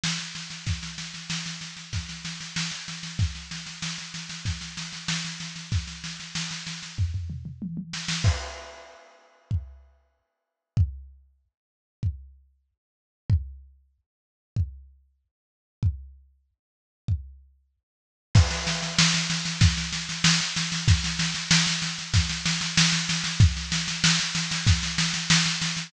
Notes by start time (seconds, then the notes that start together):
0.04 snare
0.19 snare
0.35 snare
0.50 snare
0.67 kick, snare
0.83 snare
0.98 snare
1.14 snare
1.30 snare
1.46 snare
1.61 snare
1.77 snare
1.93 kick, snare
2.09 snare
2.25 snare
2.41 snare
2.56 snare
2.72 snare
2.88 snare
3.03 snare
3.19 kick, snare
3.35 snare
3.51 snare
3.66 snare
3.82 snare
3.98 snare
4.14 snare
4.29 snare
4.45 kick, snare
4.61 snare
4.77 snare
4.93 snare
5.08 snare
5.25 snare
5.40 snare
5.56 snare
5.72 kick, snare
5.88 snare
6.04 snare
6.20 snare
6.35 snare
6.51 snare
6.67 snare
6.83 snare
6.98 kick, floor tom
7.14 floor tom
7.30 mid tom
7.45 mid tom
7.62 high tom
7.77 high tom
7.93 snare
8.08 snare
8.24 kick, crash
9.51 kick
10.77 kick
12.03 kick
13.30 kick
14.56 kick
15.83 kick
17.08 kick
18.35 kick, snare, crash
18.51 snare
18.67 snare
18.83 snare
18.99 snare
19.14 snare
19.30 snare
19.45 snare
19.61 kick, snare
19.77 snare
19.93 snare
20.09 snare
20.24 snare
20.41 snare
20.56 snare
20.72 snare
20.88 kick, snare
21.04 snare
21.19 snare
21.35 snare
21.51 snare
21.67 snare
21.82 snare
21.99 snare
22.14 kick, snare
22.29 snare
22.46 snare
22.61 snare
22.78 snare
22.93 snare
23.09 snare
23.24 snare
23.40 kick, snare
23.57 snare
23.72 snare
23.88 snare
24.04 snare
24.20 snare
24.35 snare
24.51 snare
24.67 kick, snare
24.83 snare
24.98 snare
25.14 snare
25.30 snare
25.46 snare
25.62 snare
25.77 snare